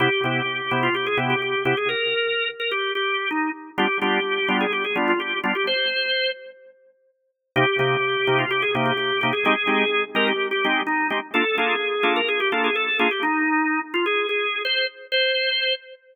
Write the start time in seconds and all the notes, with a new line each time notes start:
0.00 C3 B3 E4 G4
0.24 C3 B3 E4 G4
0.71 C3 B3 E4 G4
0.83 F4
0.95 G4
1.06 G#4
1.17 C3 B3 E4 G4
1.30 G4
1.42 G4
1.65 C3 B3 E4 G4
1.77 G#4
1.89 A#4
2.60 A#4
2.71 G4
2.95 G4
3.31 D#4
3.78 G3 B3 D4 F4 G4
4.01 G3 B3 D4 F4 G4
4.49 G3 B3 D4 F4
4.61 G#4
4.73 G4
4.84 G#4
4.96 G3 B3 D4 F4
5.08 F4
5.20 G4
5.44 G3 B3 D4 F4
5.55 G4
5.67 C5
7.56 C3 A#3 D#4 G4
7.79 C3 A#3 D#4 G4
8.27 C3 A#3 D#4 G4
8.39 F4
8.51 G4
8.62 G#4
8.75 C3 A#3 D#4 G4
8.86 G4
8.97 G4
9.21 C3 A#3 D#4 G4
9.33 G#4
9.45 G#3 C4 D#4 G4 G#4
9.67 G#3 C4 D#4 G4
10.15 G#3 C4 D#4 G4 A#4
10.28 G4
10.51 G4
10.65 G#3 C4 D#4 G4
10.87 D#4
11.10 G#3 C4 D#4 G4
11.34 A#3 D4 F4 A4
11.58 A#3 D4 F4 G#4 A4
12.03 A#3 D4 F4 A4
12.16 A#4
12.28 G#4
12.40 G4
12.52 A#3 D4 F4 A4
12.64 G#4
12.75 A4
12.99 A#3 D4 F4 G#4 A4
13.11 G4
13.23 D#4
13.94 F4
14.06 G#4
14.29 G#4
14.65 C5
15.12 C5